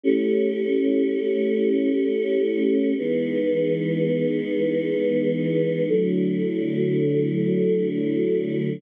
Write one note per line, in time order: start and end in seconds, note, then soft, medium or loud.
0.04 2.93 A3 loud
0.04 2.93 C#4 loud
0.04 2.93 E4 medium
0.04 2.93 G4 loud
2.97 5.87 E3 medium
2.97 5.87 G#3 loud
2.97 5.87 B3 loud
2.97 5.87 D#4 medium
5.88 8.78 D3 medium
5.88 8.78 F#3 medium
5.88 8.78 A3 medium
5.88 8.78 E4 loud